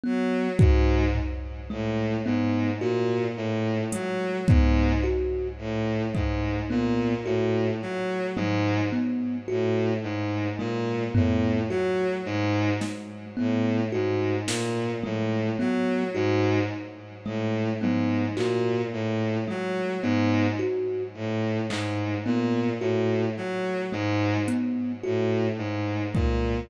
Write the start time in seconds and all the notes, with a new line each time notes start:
0.03 F#3 B3
0.59 G#2 F#4, kick
1.15 floor tom
1.70 A2 G#3
2.26 G#2 B3
2.81 A#2 F#4
3.37 A2
3.92 F#3 G#3, closed hi-hat
4.48 G#2 B3, kick
5.03 F#4
5.59 A2
6.15 G#2 G#3, kick
6.70 A#2 B3
7.25 A2 F#4
7.82 F#3
8.36 G#2 G#3, high tom
8.92 B3
9.48 A2 F#4
10.03 G#2
10.59 A#2 G#3
11.15 A2 B3, floor tom
11.69 F#3 F#4
12.26 G#2
12.81 G#3, snare
13.37 A2 B3
13.92 G#2 F#4
14.47 A#2, snare
15.03 A2 G#3, high tom
15.59 F#3 B3
16.15 G#2 F#4
17.25 A2 G#3
17.81 G#2 B3, high tom
18.37 A#2 F#4, clap
18.93 A2
19.48 F#3 G#3
20.02 G#2 B3
20.59 F#4
21.15 A2
21.70 G#2 G#3, clap
22.25 A#2 B3
22.81 A2 F#4
23.37 F#3
23.92 G#2 G#3
24.48 B3, closed hi-hat
25.03 A2 F#4
25.58 G#2
26.14 A#2 G#3, kick